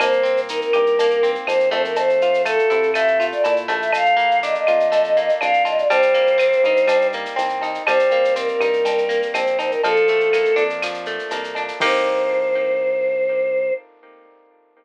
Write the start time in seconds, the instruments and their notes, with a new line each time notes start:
0.00 synth bass 1 C2, acoustic guitar (steel) A#3, choir aahs C5, cowbell, claves, shaker
0.12 shaker
0.23 acoustic guitar (steel) C4, shaker
0.37 shaker
0.49 acoustic guitar (steel) D#4, choir aahs A#4, shaker
0.61 choir aahs A#4, shaker
0.73 synth bass 1 G2, acoustic guitar (steel) G4, claves, shaker
0.86 shaker
0.99 acoustic guitar (steel) A#3, cowbell, shaker
1.11 shaker
1.23 acoustic guitar (steel) C4, shaker
1.35 shaker
1.46 synth bass 1 F2, acoustic guitar (steel) D#4, choir aahs C5, cowbell, claves, shaker
1.60 shaker
1.70 synth bass 1 F2, acoustic guitar (steel) A3, choir aahs C5, cowbell, shaker
1.85 choir aahs A#4, shaker
1.96 choir aahs C5, cowbell, shaker
2.10 shaker
2.21 acoustic guitar (steel) F4, shaker
2.34 shaker
2.45 acoustic guitar (steel) A3, choir aahs A4, claves, shaker
2.59 shaker
2.70 synth bass 1 C3, acoustic guitar (steel) E4, shaker
2.83 shaker
2.94 acoustic guitar (steel) A3, choir aahs E5, cowbell, claves, shaker
3.08 shaker
3.20 acoustic guitar (steel) F4, shaker
3.32 choir aahs D5, shaker
3.43 synth bass 1 A#2, acoustic guitar (steel) E4, choir aahs D5, cowbell, shaker
3.56 shaker
3.68 synth bass 1 A#1, acoustic guitar (steel) A3, cowbell, shaker
3.80 choir aahs E5, shaker
3.93 choir aahs F5, cowbell, claves, shaker
4.05 shaker
4.17 acoustic guitar (steel) A#3, shaker
4.31 shaker
4.43 acoustic guitar (steel) D4, choir aahs D#5, shaker
4.55 choir aahs D#5, shaker
4.67 synth bass 1 F2, acoustic guitar (steel) F4, claves, shaker
4.80 shaker
4.92 acoustic guitar (steel) A3, cowbell, shaker
5.04 shaker
5.16 acoustic guitar (steel) A#3, shaker
5.29 shaker
5.41 synth bass 1 C2, acoustic guitar (steel) D4, choir aahs F5, cowbell, claves, shaker
5.54 shaker
5.65 acoustic guitar (steel) F4, choir aahs D#5, cowbell, shaker
5.76 choir aahs D5, shaker
5.89 synth bass 1 C2, acoustic guitar (steel) G3, choir aahs C5, cowbell, shaker
6.02 shaker
6.14 acoustic guitar (steel) A#3, shaker
6.27 shaker
6.38 acoustic guitar (steel) C4, claves, shaker
6.53 shaker
6.64 synth bass 1 G2, acoustic guitar (steel) D#4, shaker
6.77 shaker
6.87 acoustic guitar (steel) G3, cowbell, claves, shaker
7.01 shaker
7.12 acoustic guitar (steel) A#3, shaker
7.26 shaker
7.36 synth bass 1 C2, acoustic guitar (steel) C4, cowbell, shaker
7.49 shaker
7.61 acoustic guitar (steel) D#4, cowbell, shaker
7.75 shaker
7.86 synth bass 1 C2, acoustic guitar (steel) G3, choir aahs C5, cowbell, claves, shaker
7.99 shaker
8.11 acoustic guitar (steel) A#3, shaker
8.25 shaker
8.36 acoustic guitar (steel) C4, choir aahs A#4, shaker
8.48 choir aahs A#4, shaker
8.60 synth bass 1 G2, acoustic guitar (steel) D#4, claves, shaker
8.73 shaker
8.85 acoustic guitar (steel) G3, cowbell, shaker
8.98 shaker
9.09 acoustic guitar (steel) A#3, shaker
9.22 shaker
9.34 synth bass 1 A#1, acoustic guitar (steel) C4, choir aahs C5, cowbell, claves, shaker
9.47 shaker
9.59 acoustic guitar (steel) D#4, choir aahs C5, cowbell, shaker
9.70 choir aahs A#4, shaker
9.84 synth bass 1 A#1, acoustic guitar (steel) F3, choir aahs A4, cowbell, shaker
9.96 shaker
10.08 acoustic guitar (steel) A3, shaker
10.20 shaker
10.33 acoustic guitar (steel) A#3, claves, shaker
10.45 shaker
10.56 synth bass 1 F2, acoustic guitar (steel) D4, shaker
10.70 shaker
10.82 acoustic guitar (steel) F3, claves, shaker
10.94 shaker
11.06 acoustic guitar (steel) A3, shaker
11.19 shaker
11.31 synth bass 1 C2, acoustic guitar (steel) A#3, cowbell, shaker
11.44 shaker
11.55 acoustic guitar (steel) D4, cowbell, shaker
11.68 shaker
11.80 synth bass 1 C2, acoustic guitar (steel) A#3 C4 D#4 G4, choir aahs C5, kick, crash